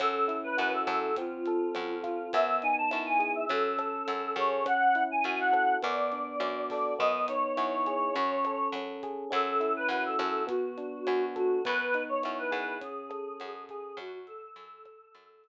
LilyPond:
<<
  \new Staff \with { instrumentName = "Choir Aahs" } { \time 4/4 \key fis \minor \tempo 4 = 103 a'8. b'16 b'16 a'8. eis'4. eis'8 | e''8 gis''16 a''8 gis''8 e''16 a'4. cis''8 | fis''8. gis''16 gis''16 fis''8. d''4. d''8 | dis''8 cis''2~ cis''8 r4 |
a'8. b'16 b'16 a'8. fis'4. fis'8 | b'8. cis''16 cis''16 b'8. gis'4. gis'8 | fis'16 fis'16 a'2~ a'8 r4 | }
  \new Staff \with { instrumentName = "Electric Piano 1" } { \time 4/4 \key fis \minor cis'8 e'8 fis'8 a'8 bis8 a'8 bis8 eis'8 | b8 dis'8 e'8 gis'8 cis'8 a'8 cis'8 gis'8 | cis'8 e'8 fis'8 a'8 b8 d'8 fis'8 a'8 | b8 dis'8 e'8 gis'8 cis'8 a'8 cis'8 gis'8 |
cis'8 e'8 fis'8 a'8 b8 d'8 fis'8 a'8 | b8 dis'8 e'8 gis'8 cis'8 a'8 cis'8 gis'8 | r1 | }
  \new Staff \with { instrumentName = "Electric Bass (finger)" } { \clef bass \time 4/4 \key fis \minor fis,4 fis,8 fis,4. fis,4 | fis,4 fis,4 fis,4 fis,8 fis,8~ | fis,4 fis,4 fis,4 fis,4 | fis,4 fis,4 fis,4 fis,4 |
fis,4 fis,8 fis,4. fis,4 | fis,4 fis,8 fis,4. fis,4 | fis,4 fis,4 fis,4 r4 | }
  \new DrumStaff \with { instrumentName = "Drums" } \drummode { \time 4/4 <hh bd ss>8 hh8 hh8 <hh bd ss>8 <hh bd>8 hh8 <hh ss>8 <hh bd>8 | <hh bd>8 hh8 <hh ss>8 <hh bd>8 <hh bd>8 <hh ss>8 hh8 <hh bd>8 | <hh bd ss>8 hh8 hh8 <bd ss>8 <hh bd>8 hh8 <hh ss>8 <hho bd>8 | bd8 hh8 <hh ss>8 <hh bd>8 <hh bd>8 <hh ss>8 hh8 <hh bd>8 |
<hh bd ss>8 hh8 hh8 <hh bd ss>8 <hh bd>8 hh8 <hh ss>8 <hh bd>8 | <hh bd>8 hh8 <hh ss>8 <hh bd>8 <hh bd>8 <hh ss>8 hh8 <hh bd>8 | <hh bd ss>8 hh8 hh8 <hh bd ss>8 <hh bd>8 hh8 r4 | }
>>